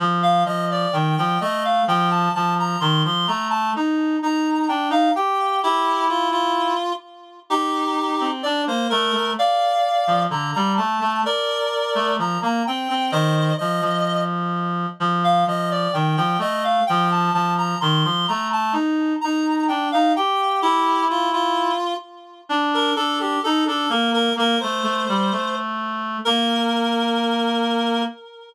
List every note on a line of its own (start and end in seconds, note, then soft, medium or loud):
0.00 0.44 F3 loud
0.23 0.43 F5 medium
0.46 0.86 F3 medium
0.46 0.68 D#5 medium
0.71 0.94 D5 medium
0.93 1.16 D#3 medium
0.93 1.15 G5 medium
1.17 1.38 F3 loud
1.17 1.40 G5 medium
1.41 1.82 A3 medium
1.41 1.64 D#5 medium
1.65 1.85 F5 medium
1.88 2.29 F3 loud
1.88 2.10 G5 loud
2.10 2.33 A5 medium
2.35 2.76 F3 medium
2.35 2.54 A5 loud
2.59 2.80 A#5 medium
2.80 3.03 D#3 loud
2.80 3.03 C6 medium
3.05 3.26 F3 medium
3.05 3.28 C6 medium
3.27 3.72 A3 medium
3.27 3.48 A#5 medium
3.50 3.71 A5 medium
3.76 4.16 D#4 loud
4.22 4.67 D#4 medium
4.22 4.66 A#5 medium
4.68 4.88 D4 medium
4.68 4.89 G5 medium
4.90 5.09 D#4 loud
4.90 5.12 F5 medium
5.15 5.60 G4 loud
5.15 5.60 G5 medium
5.63 6.06 E4 medium
5.63 6.73 E4 loud
5.63 6.06 G4 medium
6.09 6.29 F4 medium
6.31 6.93 F4 medium
7.50 8.29 D#4 medium
7.50 8.29 G4 medium
8.21 8.43 C4 medium
8.43 8.65 D4 loud
8.43 8.62 D5 medium
8.67 8.88 A#3 medium
8.67 8.87 C5 medium
8.90 9.12 A3 loud
8.90 9.31 A#4 medium
9.12 9.33 A3 medium
9.39 10.23 D5 medium
9.39 10.23 F5 medium
10.07 10.27 F3 medium
10.30 10.51 D3 medium
10.30 10.51 A#5 medium
10.54 10.77 G3 loud
10.54 10.73 A#5 medium
10.77 10.98 A3 medium
10.77 11.21 A5 medium
11.00 11.22 A3 loud
11.25 12.14 A#4 medium
11.25 12.14 D5 medium
11.95 12.16 A3 loud
12.18 12.38 F3 medium
12.18 12.40 A#5 medium
12.42 12.62 A#3 loud
12.42 12.63 A#5 medium
12.67 12.88 C4 medium
12.67 13.11 G5 medium
12.90 13.11 C4 loud
13.12 13.51 D#3 loud
13.12 13.54 C5 medium
13.12 13.54 D#5 medium
13.58 13.81 F3 medium
13.58 14.22 D#5 medium
13.81 14.86 F3 medium
15.00 15.44 F3 loud
15.24 15.44 F5 medium
15.47 15.88 F3 medium
15.47 15.70 D#5 medium
15.71 15.94 D5 medium
15.93 16.16 D#3 medium
15.93 16.16 G5 medium
16.17 16.37 F3 loud
16.17 16.39 G5 medium
16.39 16.80 A3 medium
16.39 16.63 D#5 medium
16.64 16.84 F5 medium
16.87 17.30 F3 loud
16.87 17.08 G5 loud
17.11 17.33 A5 medium
17.34 17.75 F3 medium
17.34 17.54 A5 loud
17.58 17.79 A#5 medium
17.81 18.04 D#3 loud
17.81 18.03 C6 medium
18.04 18.26 F3 medium
18.04 18.26 C6 medium
18.28 18.74 A3 medium
18.28 18.48 A#5 medium
18.53 18.73 A5 medium
18.73 19.13 D#4 loud
19.21 19.68 D#4 medium
19.21 19.64 A#5 medium
19.68 19.89 D4 medium
19.68 19.89 G5 medium
19.92 20.13 D#4 loud
19.92 20.12 F5 medium
20.16 20.61 G4 loud
20.16 20.60 G5 medium
20.62 21.05 E4 medium
20.62 21.72 E4 loud
20.62 21.05 G4 medium
21.10 21.30 F4 medium
21.33 21.94 F4 medium
22.49 22.91 D4 loud
22.74 22.94 A#4 medium
22.96 23.36 D4 medium
22.96 23.19 A4 medium
23.20 23.40 G4 medium
23.44 23.64 D#4 loud
23.44 23.64 A4 medium
23.67 23.86 D4 medium
23.67 23.91 A4 medium
23.89 24.29 A#3 loud
23.89 24.10 A#4 medium
24.14 24.33 A#4 medium
24.36 24.56 A#3 loud
24.36 24.59 A#4 medium
24.60 24.83 A3 medium
24.60 25.56 C5 medium
24.83 25.04 A3 loud
25.09 25.31 G3 loud
25.32 26.18 A3 medium
26.25 28.04 A#3 loud
26.25 28.02 A#4 loud